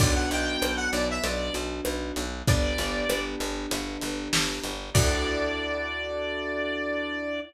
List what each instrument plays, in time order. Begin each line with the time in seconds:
0.00 electric bass (finger) B1, acoustic grand piano B3 D4 F#4, lead 1 (square) D5, kick, crash
0.14 lead 1 (square) F#5
0.31 electric bass (finger) B1, lead 1 (square) G5, closed hi-hat
0.62 electric bass (finger) B1, cross-stick
0.76 lead 1 (square) F#5
0.92 electric bass (finger) B1, lead 1 (square) D5, closed hi-hat
1.11 lead 1 (square) E5
1.24 electric bass (finger) B1, lead 1 (square) D5, closed hi-hat
1.54 electric bass (finger) B1, closed hi-hat
1.85 electric bass (finger) B1, cross-stick
2.16 electric bass (finger) B1, closed hi-hat
2.47 electric bass (finger) G1, acoustic grand piano B3 D4 G4, lead 1 (square) D5, kick, closed hi-hat
2.78 electric bass (finger) G1, closed hi-hat
3.09 electric bass (finger) G1, cross-stick
3.40 electric bass (finger) G1, closed hi-hat
3.71 electric bass (finger) G1, closed hi-hat
4.01 electric bass (finger) G1, closed hi-hat
4.33 electric bass (finger) G1, snare
4.64 electric bass (finger) G1, closed hi-hat
4.94 electric bass (finger) D2, acoustic grand piano D4 E4 F#4 A4, lead 1 (square) D5, kick, crash